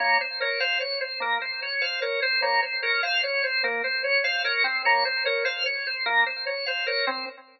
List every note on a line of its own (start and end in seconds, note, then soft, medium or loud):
0.00 0.18 A#3 medium
0.00 0.18 C#5 medium
0.21 0.39 C5 medium
0.40 0.59 A#4 medium
0.40 0.60 C#5 medium
0.60 0.79 C5 medium
0.60 0.78 F5 medium
0.80 0.99 C#5 medium
1.01 1.19 C5 medium
1.20 1.38 A#3 medium
1.20 1.40 A#4 medium
1.42 1.60 C5 medium
1.62 1.81 C#5 medium
1.81 2.00 C5 medium
1.81 2.00 F5 medium
2.02 2.20 A#4 medium
2.02 2.20 C#5 medium
2.22 2.41 C5 medium
2.42 2.60 A#3 medium
2.42 2.61 C#5 medium
2.62 2.81 C5 medium
2.82 3.02 A#4 medium
2.82 3.01 C#5 medium
3.03 3.22 C5 medium
3.03 3.21 F5 medium
3.23 3.42 C#5 medium
3.44 3.62 C5 medium
3.64 3.82 A#3 medium
3.64 3.82 A#4 medium
3.84 4.02 C5 medium
4.04 4.22 C#5 medium
4.24 4.43 C5 medium
4.24 4.42 F5 medium
4.44 4.63 A#4 medium
4.44 4.63 C#5 medium
4.64 4.82 C4 medium
4.64 4.83 C5 medium
4.85 5.04 A#3 loud
4.85 5.04 C#5 medium
5.05 5.24 C5 medium
5.25 5.45 A#4 medium
5.25 5.43 C#5 medium
5.45 5.63 C5 medium
5.45 5.64 F5 medium
5.66 5.84 C#5 medium
5.87 6.05 C5 medium
6.06 6.24 A#3 medium
6.06 6.24 A#4 medium
6.26 6.45 C5 medium
6.46 6.65 C#5 medium
6.66 6.86 C5 medium
6.66 6.84 F5 medium
6.87 7.05 A#4 medium
6.87 7.06 C#5 medium
7.07 7.25 C4 medium
7.07 7.25 C5 medium